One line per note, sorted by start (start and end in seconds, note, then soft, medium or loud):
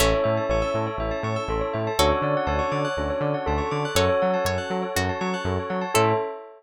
0.00 0.14 A1 loud
0.00 1.63 A3 medium
0.00 1.63 C#4 medium
0.00 0.90 C#4 loud
0.00 0.90 E4 loud
0.00 0.90 A4 loud
0.00 0.12 A4 loud
0.00 0.45 C#5 medium
0.00 0.99 C#5 medium
0.00 1.00 E5 medium
0.00 0.99 A5 medium
0.14 0.25 C#5 medium
0.24 0.39 A2 medium
0.24 0.35 E5 loud
0.37 0.48 A5 medium
0.49 0.63 A1 medium
0.49 1.44 C#5 medium
0.49 0.62 C#6 loud
0.62 0.73 E6 medium
0.74 0.88 A2 medium
0.74 0.86 A4 loud
0.87 0.98 C#5 loud
0.98 1.12 A1 medium
0.98 1.89 C#4 medium
0.98 1.89 E4 medium
0.98 1.98 A4 medium
0.98 1.89 A4 medium
0.98 1.98 C#5 medium
0.98 1.11 E5 medium
0.98 1.98 A5 medium
1.11 1.22 A5 medium
1.23 1.37 A2 medium
1.23 1.35 C#6 medium
1.36 1.47 E6 medium
1.48 1.62 A1 medium
1.48 1.60 A4 medium
1.48 1.93 A4 medium
1.61 1.72 C#5 medium
1.73 1.88 A2 medium
1.73 1.85 E5 medium
1.87 1.98 A5 medium
1.99 2.12 D2 loud
1.99 2.88 C#4 medium
1.99 2.88 D4 loud
1.99 2.88 F#4 loud
1.99 3.80 F#4 medium
1.99 2.10 A4 loud
1.99 2.88 A4 medium
1.99 3.80 A4 medium
1.99 2.42 C#5 medium
1.99 2.98 C#5 medium
1.99 2.98 D5 medium
1.99 2.98 F#5 medium
1.99 2.98 A5 medium
2.12 2.23 C#5 medium
2.22 2.35 D3 medium
2.22 2.34 D5 medium
2.37 2.48 F#5 loud
2.47 2.60 D2 medium
2.47 3.42 C#5 medium
2.47 2.58 A5 loud
2.59 2.70 C#6 medium
2.72 2.85 D3 medium
2.72 2.83 D6 medium
2.85 2.96 F#6 medium
2.97 3.11 D2 medium
2.97 3.87 C#4 medium
2.97 3.87 D4 medium
2.97 3.87 F#4 medium
2.97 3.09 A4 medium
2.97 3.87 A4 medium
2.97 3.97 C#5 medium
2.97 3.97 D5 medium
2.97 3.97 A5 medium
2.97 3.97 C#6 medium
3.10 3.21 C#5 medium
3.21 3.34 D3 medium
3.21 3.33 D5 medium
3.34 3.45 F#5 medium
3.46 3.61 D2 loud
3.46 3.90 A4 medium
3.46 3.59 A5 loud
3.58 3.69 C#6 medium
3.71 3.85 D3 medium
3.71 3.83 D6 medium
3.85 3.96 F#6 medium
3.95 4.09 F#2 loud
3.95 4.86 C#4 medium
3.95 4.86 F#4 loud
3.95 4.38 A4 medium
3.95 4.86 A4 loud
3.95 4.08 A4 loud
3.95 4.38 C#5 medium
3.95 4.57 C#5 medium
3.95 4.95 C#5 medium
3.95 4.95 F#5 medium
3.95 4.95 A5 medium
4.09 4.20 C#5 medium
4.22 4.36 F#3 medium
4.22 4.33 F#5 medium
4.34 4.45 A5 medium
4.45 4.58 F#2 medium
4.45 4.91 C#5 medium
4.45 4.59 C#6 medium
4.58 4.69 F#6 medium
4.70 4.84 F#3 medium
4.70 4.82 A4 medium
4.82 4.93 C#5 medium
4.95 5.10 F#2 loud
4.95 5.84 C#4 medium
4.95 5.84 F#4 medium
4.95 5.19 F#4 medium
4.95 5.84 A4 medium
4.95 5.95 C#5 medium
4.95 5.07 F#5 medium
4.95 5.95 A5 medium
4.95 5.95 C#6 medium
5.09 5.20 A5 medium
5.21 5.35 F#3 medium
5.21 5.32 C#6 loud
5.34 5.45 F#6 medium
5.45 5.58 F#2 loud
5.45 5.57 A4 medium
5.59 5.71 C#5 medium
5.70 5.84 F#3 medium
5.70 5.81 F#5 medium
5.81 5.93 A5 medium
5.94 6.13 A2 loud
5.94 6.12 C#4 loud
5.94 6.12 C#4 medium
5.94 6.12 E4 loud
5.94 6.12 A4 loud
5.94 6.13 A4 loud
5.94 6.13 C#5 medium
5.94 6.13 E5 loud